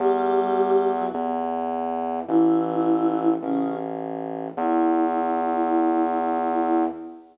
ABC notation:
X:1
M:12/8
L:1/8
Q:3/8=105
K:Edor
V:1 name="Choir Aahs"
[G,G]5 [F,F] z6 | [E,E]6 [C,C]2 z4 | E12 |]
V:2 name="Synth Bass 2" clef=bass
E,,6 E,,6 | A,,,6 A,,,6 | E,,12 |]